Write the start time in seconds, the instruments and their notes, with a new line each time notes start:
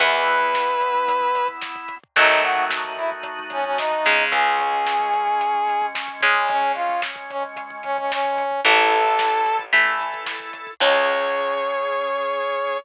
0.00 electric bass (finger) E2, overdriven guitar E3 B3, drawbar organ B3 E4, brass section B4, kick, crash
0.13 kick
0.27 kick, closed hi-hat
0.41 kick
0.54 kick, snare
0.68 kick
0.81 kick, closed hi-hat
0.95 kick
1.08 kick, closed hi-hat
1.21 kick
1.35 kick, closed hi-hat
1.48 kick
1.61 kick, snare
1.76 kick
1.88 kick, closed hi-hat
2.03 kick
2.16 electric bass (finger) D#2, overdriven guitar D#3 F#3 A3, drawbar organ A3 D#4 F#4, brass section D#4, kick, closed hi-hat
2.30 kick
2.42 brass section F#4, kick, closed hi-hat
2.57 kick
2.70 kick, snare
2.85 kick
2.97 brass section E4, kick, closed hi-hat
3.12 kick
3.23 kick, closed hi-hat
3.39 kick
3.50 brass section C#4, kick, closed hi-hat
3.64 brass section C#4, kick
3.78 brass section D#4, kick, snare
3.92 kick
4.05 overdriven guitar C#3 G#3, kick, closed hi-hat
4.20 kick
4.31 electric bass (finger) C#2, drawbar organ G#3 C#4, brass section G#4, kick, closed hi-hat
4.46 kick
4.59 kick, closed hi-hat
4.73 kick
4.86 kick, snare
5.00 kick
5.13 kick, closed hi-hat
5.27 kick
5.40 kick, closed hi-hat
5.55 kick
5.67 kick, closed hi-hat
5.82 kick
5.95 kick, snare
6.08 kick
6.21 overdriven guitar C#3 G#3, kick, closed hi-hat
6.35 kick
6.48 drawbar organ G#3 C#4, brass section C#4, kick, closed hi-hat
6.62 kick
6.75 brass section F4, kick, closed hi-hat
6.89 kick
7.02 kick, snare
7.16 kick
7.30 brass section C#4, kick, closed hi-hat
7.44 kick
7.56 kick, closed hi-hat
7.70 kick
7.83 brass section C#4, kick, closed hi-hat
7.98 brass section C#4, kick
8.11 brass section C#4, kick, snare
8.25 kick
8.37 kick, closed hi-hat
8.51 kick
8.65 electric bass (finger) A1, overdriven guitar E3 A3, drawbar organ E4 A4, brass section A4, kick, closed hi-hat
8.79 kick
8.91 kick, closed hi-hat
9.05 kick
9.19 kick, snare
9.32 kick
9.46 kick, closed hi-hat
9.59 kick
9.73 overdriven guitar E3 A3, drawbar organ E4 A4, kick, closed hi-hat
9.85 kick
10.00 kick, closed hi-hat
10.14 kick
10.26 kick, snare
10.40 kick
10.53 kick, closed hi-hat
10.67 kick
10.80 electric bass (finger) C#2, overdriven guitar G#3 C#4, drawbar organ C#4 G#4, brass section C#5, kick, crash